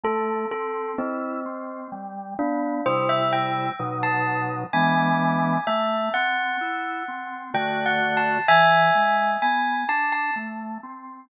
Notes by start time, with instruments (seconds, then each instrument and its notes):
0.04 drawbar organ A3, tubular bells A4
0.51 drawbar organ C4, tubular bells A4
0.98 tubular bells C4, drawbar organ E4
1.46 drawbar organ C4
1.92 drawbar organ G3
2.38 drawbar organ B3, tubular bells D4
2.85 drawbar organ C3 G3 E4, tubular bells C5
3.09 tubular bells E5
3.33 tubular bells G5
3.79 drawbar organ B2 F#3 D#4
4.03 tubular bells A5
4.73 drawbar organ E3 G#3 B3 D4, tubular bells G#5
5.67 drawbar organ A3, tubular bells E5
6.14 drawbar organ C4, tubular bells F#5
6.61 drawbar organ E4
7.08 drawbar organ C4
7.54 drawbar organ D3 A3 F#4, tubular bells G5
7.86 tubular bells F#5
8.17 tubular bells A5
8.48 drawbar organ E3, tubular bells E5 G#5
8.95 drawbar organ G#3
9.42 drawbar organ B3, tubular bells G#5
9.89 drawbar organ D4, tubular bells A5
10.12 tubular bells A5
10.36 drawbar organ A3
10.83 drawbar organ C4